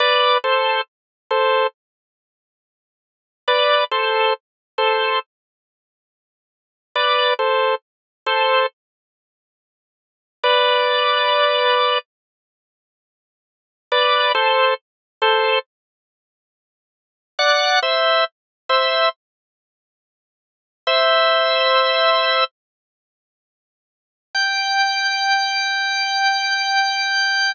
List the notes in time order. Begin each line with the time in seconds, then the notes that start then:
0.00 B4 D5
0.44 A4 C5
1.31 A4 C5
3.48 B4 D5
3.91 A4 C5
4.78 A4 C5
6.95 B4 D5
7.39 A4 C5
8.26 A4 C5
10.43 B4 D5
13.92 B4 D5
14.35 A4 C5
15.22 A4 C5
17.39 D5 F#5
17.82 C5 E5
18.69 C5 E5
20.87 C5 E5
24.35 G5